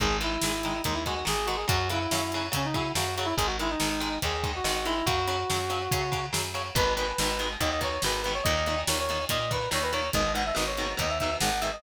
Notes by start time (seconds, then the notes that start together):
0.00 G#1 D#3 G#3 G#4, kick, closed hi-hat
0.21 D#3 G#3 E4, closed hi-hat
0.41 G#1 D#3 G#3, snare
0.63 D#3 G#3, closed hi-hat
0.84 D#2 D#3 G#3 D#4, kick, closed hi-hat
0.93 E4
1.06 D#3 G#3 F#4, kick, closed hi-hat
1.25 G#1 D#3 G#3 G#4, snare
1.46 D#3 G#3 F#4, closed hi-hat
1.56 G#4
1.68 F#2 C#3 F#3 F#4, kick, closed hi-hat
1.90 C#3 F#3 E4, closed hi-hat
2.11 F#2 C#3 F#3, snare
2.32 C#3 F#3, closed hi-hat
2.52 C#3 F#3 C#4, kick, closed hi-hat
2.65 D#4
2.74 C#3 F#3 E4, kick, closed hi-hat
2.95 F#2 C#3 F#3 F#4, snare
3.16 C#3 F#3 F#4, closed hi-hat
3.25 E4
3.37 G#1 D#3 G#3 G#4, kick, closed hi-hat
3.46 F#4
3.59 D#3 G#3 E4, closed hi-hat
3.70 D#4
3.80 G#1 D#3 G#3, snare
4.00 D#3 G#3, closed hi-hat
4.22 D#2 D#3 G#3 G#4, kick, closed hi-hat
4.44 D#3 G#3, kick, closed hi-hat
4.56 F#4
4.64 G#1 D#3 G#3, snare
4.85 D#3 G#3 E4, closed hi-hat
5.06 F#2 C#3 F#3 F#4, kick, closed hi-hat
5.28 C#3 F#3, closed hi-hat
5.50 F#2 C#3 F#3, snare
5.70 C#3 F#3, closed hi-hat
5.91 C#3 F#3, kick, closed hi-hat
6.12 C#3 F#3, kick, closed hi-hat
6.33 F#2 C#3 F#3, snare
6.54 C#3 F#3, closed hi-hat
6.75 G#1 B2 D#3 G#3 B4, kick, closed hi-hat
6.96 B2 D#3 G#3 B4, closed hi-hat
7.18 G#1 B2 D#3 G#3, snare
7.39 B2 D#3 G#3, closed hi-hat
7.60 D#2 B2 D#3 G#3 D#5, kick, closed hi-hat
7.71 D#5
7.81 B2 D#3 G#3 C#5, kick, closed hi-hat
8.02 G#1 B2 D#3 B4, snare
8.06 G#3
8.22 B2 B4, closed hi-hat
8.26 D#3 G#3
8.34 C#5
8.43 D#2 A#2 D#3 D#5, kick, closed hi-hat
8.66 A#2 D#3, closed hi-hat
8.87 D#2 A#2 D#3 C#5, snare
8.99 C#5
9.09 A#2 D#3, closed hi-hat
9.29 A#2 D#3 D#5, kick, closed hi-hat
9.51 A#2 D#3 B4, kick, closed hi-hat
9.71 D#2 A#2 D#3 C#5, snare
9.82 B4
9.93 A#2 D#3 C#5, closed hi-hat
10.13 G#1 G#2 B2 D#3 D#5, kick, closed hi-hat
10.34 G#2 B2 D#3 F#5, closed hi-hat
10.46 E5
10.55 G#1 G#2 B2 D#3 D#5, snare
10.66 C#5
10.77 G#2 B2 D#3, closed hi-hat
10.97 D#2 G#2 B2 D#3 D#5, kick, closed hi-hat
11.09 E5
11.19 G#2 B2 E5, kick, closed hi-hat
11.24 D#3
11.40 G#1 G#2 B2 D#3 F#5, snare
11.61 G#2 B2 D#3 E5, closed hi-hat
11.72 D#5